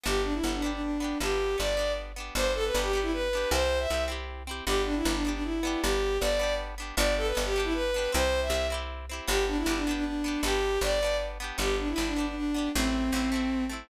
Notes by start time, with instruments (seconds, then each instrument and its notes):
0.03 electric bass (finger) G1, acoustic guitar (steel) B3 D4 G4, violin G4
0.24 violin D4
0.33 violin E4
0.43 electric bass (finger) G1, acoustic guitar (steel) B3 D4
0.48 acoustic guitar (steel) G4
0.54 violin D4
0.62 acoustic guitar (steel) B3 D4 G4
0.72 violin D4
0.82 violin D4
1.00 acoustic guitar (steel) B3 D4 G4
1.20 electric bass (finger) G1, acoustic guitar (steel) B3 D4, violin G4
1.25 acoustic guitar (steel) G4
1.58 electric bass (finger) G1, acoustic guitar (steel) B3 D4 G4, violin D5
1.77 acoustic guitar (steel) B3 D4 G4
2.16 acoustic guitar (steel) B3 D4 G4
2.35 electric bass (finger) G1, acoustic guitar (steel) B3 D4, violin C5
2.41 acoustic guitar (steel) G4
2.55 violin A4
2.64 violin B4
2.74 electric bass (finger) G1, acoustic guitar (steel) B3 D4
2.78 acoustic guitar (steel) G4
2.83 violin G4
2.93 acoustic guitar (steel) B3 D4 G4
3.02 violin E4
3.13 violin B4
3.33 acoustic guitar (steel) B3 D4 G4
3.51 electric bass (finger) C2, acoustic guitar (steel) C4 E4, violin C5
3.56 acoustic guitar (steel) G4
3.80 violin E5
3.90 electric bass (finger) C2, acoustic guitar (steel) C4 E4 G4
4.08 acoustic guitar (steel) C4 E4 G4
4.47 acoustic guitar (steel) C4 E4 G4
4.66 electric bass (finger) G1, acoustic guitar (steel) B3 D4, violin G4
4.71 acoustic guitar (steel) G4
4.86 violin D4
4.96 violin E4
5.05 electric bass (finger) G1, acoustic guitar (steel) B3 D4
5.09 acoustic guitar (steel) G4
5.14 violin D4
5.25 acoustic guitar (steel) B3 D4 G4
5.34 violin D4
5.44 violin E4
5.63 acoustic guitar (steel) B3 D4 G4
5.82 electric bass (finger) G1, violin G4
6.20 electric bass (finger) G1, acoustic guitar (steel) B3 D4, violin D5
6.25 acoustic guitar (steel) G4
6.39 acoustic guitar (steel) B3 D4 G4
6.78 acoustic guitar (steel) B3 D4 G4
6.97 electric bass (finger) G1, acoustic guitar (steel) B3 D4 G4, violin D5
7.17 violin A4
7.26 violin B4
7.35 electric bass (finger) G1, acoustic guitar (steel) B3 D4 G4
7.45 violin G4
7.56 acoustic guitar (steel) B3 D4 G4
7.64 violin E4
7.74 violin B4
7.94 acoustic guitar (steel) B3 D4 G4
8.12 electric bass (finger) C2, acoustic guitar (steel) C4 E4 G4, violin C5
8.42 violin E5
8.50 electric bass (finger) C2, acoustic guitar (steel) C4 E4
8.54 acoustic guitar (steel) G4
8.70 acoustic guitar (steel) C4 E4 G4
9.09 acoustic guitar (steel) C4 E4 G4
9.27 electric bass (finger) G1, acoustic guitar (steel) B3 D4 G4, violin G4
9.48 violin D4
9.58 violin E4
9.66 electric bass (finger) G1, acoustic guitar (steel) B3 D4
9.70 acoustic guitar (steel) G4
9.76 violin D4
9.87 acoustic guitar (steel) B3 D4 G4
9.96 violin D4
10.05 violin D4
10.24 acoustic guitar (steel) B3 D4 G4
10.43 electric bass (finger) G1, acoustic guitar (steel) B3 D4, violin G4
10.48 acoustic guitar (steel) G4
10.81 electric bass (finger) G1, acoustic guitar (steel) B3 D4, violin D5
10.86 acoustic guitar (steel) G4
11.02 acoustic guitar (steel) B3 D4 G4
11.40 acoustic guitar (steel) B3 D4 G4
11.58 electric bass (finger) G1, acoustic guitar (steel) B3 D4 G4, violin G4
11.79 violin D4
11.88 violin E4
11.96 electric bass (finger) G1, acoustic guitar (steel) B3 D4 G4
12.07 violin D4
12.16 acoustic guitar (steel) B3 D4 G4
12.26 violin D4
12.35 violin D4
12.54 acoustic guitar (steel) B3 D4 G4
12.75 electric bass (finger) A1, acoustic guitar (steel) A3 C4, violin C4
12.79 acoustic guitar (steel) E4
13.12 electric bass (finger) A1, acoustic guitar (steel) A3 C4 E4
13.32 acoustic guitar (steel) A3 C4 E4
13.69 acoustic guitar (steel) A3 C4 E4